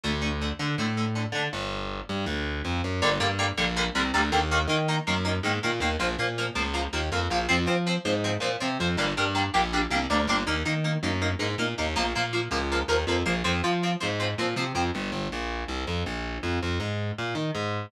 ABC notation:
X:1
M:4/4
L:1/8
Q:1/4=161
K:Gm
V:1 name="Overdriven Guitar"
[D,A,] [D,A,] [D,A,] [D,A,] [D,A,] [D,A,] [D,A,] [D,A,] | z8 | [D,G,B,] [D,G,B,] [D,G,B,] [D,G,B,] [D,G,B,] [D,G,B,] [D,G,B,] [D,G,B,] | [E,B,] [E,B,] [E,B,] [E,B,] [E,B,] [E,B,] [E,B,] [E,B,] |
[F,B,] [F,B,] [F,B,] [F,B,] [F,B,] [F,B,] [F,B,] [F,B,] | [F,C] [F,C] [F,C] [F,C] [F,C] [F,C] [F,C] [F,C] | [G,B,D] [G,B,D] [G,B,D] [G,B,D] [G,B,D] [G,B,D] [G,B,D] [G,B,D] | [B,E] [B,E] [B,E] [B,E] [B,E] [B,E] [B,E] [B,E] |
[F,B,] [F,B,] [F,B,] [F,B,] [F,B,] [F,B,] [F,B,] [F,B,] | [F,C] [F,C] [F,C] [F,C] [F,C] [F,C] [F,C] [F,C] | z8 | z8 |]
V:2 name="Electric Bass (finger)" clef=bass
D,,3 D, A,,3 D, | G,,,3 G,, D,,2 F,, ^F,, | G,,, G,,2 B,,,2 C,, D,, E,,- | E,, E,2 ^F,,2 _A,, B,, E,, |
B,,, B,,2 _D,,2 E,, F,, B,,, | F,, F,2 _A,,2 B,, C, F,, | G,,, G,,2 B,,,2 C,, D,, G,,, | E,, E,2 ^F,,2 _A,, B,, E,, |
B,,, B,,2 _D,,2 E,, F,, B,,, | F,, F,2 _A,,2 B,, C, F,, | G,,, G,,, B,,,2 C,, F,, B,,,2 | F,, F,, _A,,2 B,, E, A,,2 |]